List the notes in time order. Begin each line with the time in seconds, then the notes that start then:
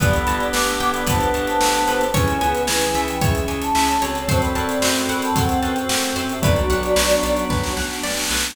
0.00 G1 B3 D4 G4 A4 B4 D5 B5, kick, closed hi-hat
0.13 closed hi-hat
0.27 G1 A5, closed hi-hat
0.40 closed hi-hat
0.53 G1 B4 F#5 D6, snare
0.67 closed hi-hat
0.80 G1 G5, closed hi-hat
0.94 D5 B5, closed hi-hat
1.07 G1 B3 D4 A4 B4 C5 A5, kick, closed hi-hat
1.21 closed hi-hat
1.34 G1 A5, closed hi-hat
1.47 C5 A5, closed hi-hat
1.60 G1 G5, snare
1.74 closed hi-hat
1.87 G1 B4, closed hi-hat
2.01 closed hi-hat
2.14 C#2 C#4 E4 G#4 B4 C#5 G#5, kick, closed hi-hat
2.28 closed hi-hat
2.41 C#2 B3 G#5, closed hi-hat
2.55 closed hi-hat
2.67 C#2 E3 B4 C#5 G#5, snare
2.81 closed hi-hat
2.94 C#2 E3 E5, closed hi-hat
3.08 G5, closed hi-hat
3.21 C#2 G#3 C#4 G#4 C#5 E5, kick, closed hi-hat
3.35 closed hi-hat
3.48 C#2 G#5, closed hi-hat
3.62 C#5 A5, closed hi-hat
3.75 C#2 E5, snare
3.88 closed hi-hat
4.02 C#2 C4 F#4 A4 C#5, closed hi-hat
4.15 closed hi-hat
4.27 F#2 C4 F#4 A4 C5 A5, kick, closed hi-hat
4.41 D5 B5, closed hi-hat
4.55 F#2 A5, closed hi-hat
4.69 closed hi-hat
4.82 F#2 C5, snare
4.96 closed hi-hat
5.09 F#2 D5 F#5 B5, closed hi-hat
5.22 C5 A5, closed hi-hat
5.35 F#2 C4 A4 C5 F#5, kick, closed hi-hat
5.49 closed hi-hat
5.62 F#2 B4 G5 A5, closed hi-hat
5.76 closed hi-hat
5.89 F#2 F#5, snare
6.03 closed hi-hat
6.16 F#2 C5, closed hi-hat
6.29 G4 E5, closed hi-hat
6.42 B1 F#3 B3 D4 F#4 B4 D5, kick, closed hi-hat
6.56 closed hi-hat
6.70 B1 F#5, closed hi-hat
6.83 closed hi-hat
6.96 B1 B4, snare
7.10 closed hi-hat
7.23 B1 D5, closed hi-hat
7.37 closed hi-hat
7.50 B1 F#3 B3 F#4 B4, kick, snare
7.64 snare
7.76 B1 F#5, snare
7.90 snare
8.03 B1 D5, snare
8.10 snare
8.17 snare
8.24 snare
8.30 B1 B4, snare
8.37 snare
8.44 snare
8.50 snare